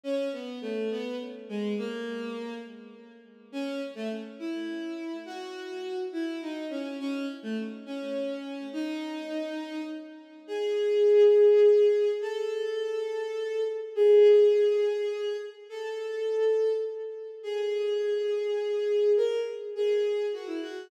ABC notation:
X:1
M:6/8
L:1/16
Q:3/8=69
K:F#m
V:1 name="Violin"
C2 B,2 A,2 B,2 z2 G,2 | ^A,6 z6 | [K:C#m] C2 z A, z2 E6 | F6 E2 D2 C2 |
C2 z A, z2 C6 | D8 z4 | [K:E] G12 | A12 |
G12 | A8 z4 | [K:C#m] G12 | ^A2 z2 G4 F E F2 |]